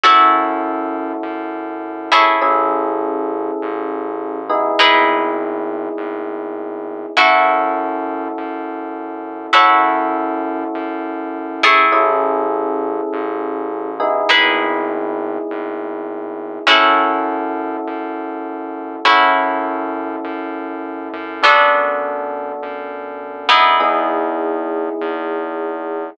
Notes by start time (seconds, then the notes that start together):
0.04 F#2 C#4 E4 F#4 A4 C#5
1.23 F#2
2.12 E4 G#4 A4 C#5
2.41 A1 C#4 E4 G#4 A4
3.62 A1
4.50 B3 D#4 E4 G#4
4.79 G#1 D#4 E4 G#4 B4
5.97 G#1
7.17 F#2 C#4 E4 F#4 A4
8.38 F#2
9.53 F#2 C#4 E4 F#4 A4 C#5
10.75 F#2
11.63 E4 G#4 A4 C#5
11.92 A1 C#4 E4 G#4 A4
13.13 A1
14.00 B3 D#4 E4 G#4
14.29 G#1 D#4 E4 G#4 B4
15.50 G#1
16.67 F#2 C#4 E4 F#4 A4
17.87 F#2
19.05 F#2 C#4 E4 F#4 A4
20.24 F#2
21.13 F#2
21.43 B3 D4 F#4 A4
22.63 F#2
23.49 B3 D#4 E4 G#4
23.80 E2 B3 D#4 E4 G#4
25.01 E2